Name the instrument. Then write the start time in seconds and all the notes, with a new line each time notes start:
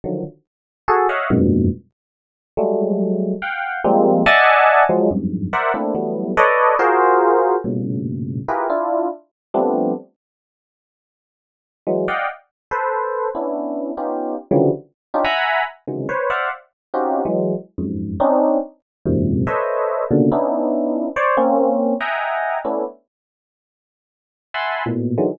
electric piano 1
0.04 D3 D#3 F3 F#3
0.88 F#4 G#4 A4
1.09 C#5 D#5 E5 F5 F#5
1.30 F2 F#2 G2 G#2 A#2 B2
2.57 F#3 G3 G#3 A3
3.42 F5 F#5 G5
3.84 F3 G3 G#3 A#3 C4
4.26 D5 D#5 E5 F#5 G#5 A5
4.89 F3 F#3 G#3
5.11 F2 F#2 G2 G#2
5.53 A#4 C5 D5 E5 F#5
5.74 A3 A#3 C4 D4 E4
5.95 E3 F#3 G3 A3 B3
6.37 A4 B4 C#5 D5 D#5
6.79 F4 F#4 G#4 A#4 C5
7.64 G2 A2 A#2 B2 C#3
8.48 E4 F4 G4 G#4 A#4 B4
8.70 D4 E4 F4
9.54 F3 G3 A3 B3 C4 D4
11.87 E3 F#3 G#3
12.08 D5 D#5 F5 F#5 G5
12.71 A4 B4 C5
13.35 B3 C#4 D4 E4
13.97 B3 C#4 D#4 F4 G4
14.51 C#3 D3 E3 F3 F#3 G3
15.14 C#4 D4 D#4 F4 G4
15.25 E5 F#5 G#5 A#5 B5
15.87 C3 C#3 D#3 E3 F#3 G#3
16.09 B4 C5 C#5
16.30 C5 D5 E5 F5 F#5
16.94 C4 C#4 D#4 F4 F#4 G4
17.25 E3 F#3 G#3
17.78 F2 F#2 G#2
18.20 C4 C#4 D4 D#4
19.06 E2 F#2 G#2 A#2 C3
19.47 A4 B4 C5 C#5 D#5 E5
20.11 A#2 B2 C#3 D3
20.32 B3 C#4 D4 D#4 E4
21.16 C5 C#5 D5
21.37 A#3 C4 C#4
22.01 D#5 E5 F#5 G5 G#5 A#5
22.65 A3 B3 C#4 D4 E4
24.54 E5 F#5 G#5 A5 B5 C6
24.86 A2 A#2 B2
25.18 D3 D#3 E3 F#3 G#3